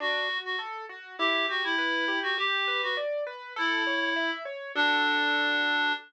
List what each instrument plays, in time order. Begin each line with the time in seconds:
0.00 acoustic grand piano D4, clarinet F#4
0.29 acoustic grand piano F#4
0.45 clarinet F#4
0.59 acoustic grand piano A4
0.89 acoustic grand piano F#4
1.19 acoustic grand piano E4, clarinet G4
1.49 clarinet F#4, acoustic grand piano G4
1.64 clarinet E4
1.78 acoustic grand piano B4
2.08 acoustic grand piano G4
2.23 clarinet F#4
2.38 acoustic grand piano G4, clarinet G4
2.68 acoustic grand piano B4
2.83 clarinet F#4
2.97 acoustic grand piano D5
3.27 acoustic grand piano B4
3.56 clarinet E4, acoustic grand piano A4
3.87 acoustic grand piano C#5
4.16 acoustic grand piano E5
4.45 acoustic grand piano C#5
4.75 acoustic grand piano D4 F#4 A4, clarinet D4